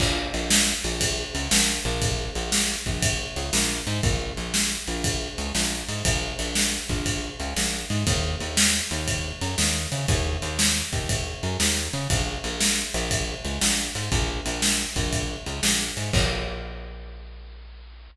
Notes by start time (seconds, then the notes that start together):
0.00 A#1, kick, crash
0.34 A#1, ride
0.50 snare
0.84 A#1, ride
1.01 kick, ride
1.35 C#2, ride
1.51 A#1, snare
1.85 A#1, ride
2.02 kick, ride
2.35 A#1, ride
2.52 snare
2.86 A#1, kick, ride
3.02 kick, ride
3.36 C#2, ride
3.53 A#1, snare
3.87 G#2, ride
4.03 A#1, kick, ride
4.37 A#1, ride
4.54 snare
4.88 A#1, ride
5.04 kick, ride
5.38 C#2, ride
5.55 A#1, snare
5.88 G#2, ride
6.05 A#1, kick, ride
6.39 A#1, ride
6.55 snare
6.89 A#1, kick, ride
7.06 kick, ride
7.40 C#2, ride
7.56 A#1, snare
7.90 G#2, ride
8.07 D#2, kick, ride
8.40 D#2, ride
8.57 snare
8.91 D#2, ride
9.08 kick, ride
9.41 F#2, ride
9.58 D#2, snare
9.92 C#3, ride
10.08 D#2, kick, ride
10.42 D#2, ride
10.59 snare
10.93 D#2, kick, ride
11.09 kick, ride
11.43 F#2, ride
11.60 D#2, snare
11.93 C#3, ride
12.10 A#1, kick, ride
12.44 A#1, ride
12.61 snare
12.94 A#1, ride
13.11 kick, ride
13.45 C#2, ride
13.61 A#1, snare
13.95 G#2, ride
14.12 A#1, kick, ride
14.46 A#1, ride
14.62 snare
14.96 A#1, kick, ride
15.13 kick, ride
15.46 C#2, ride
15.63 A#1, snare
15.97 G#2, ride
16.13 A#1, kick, crash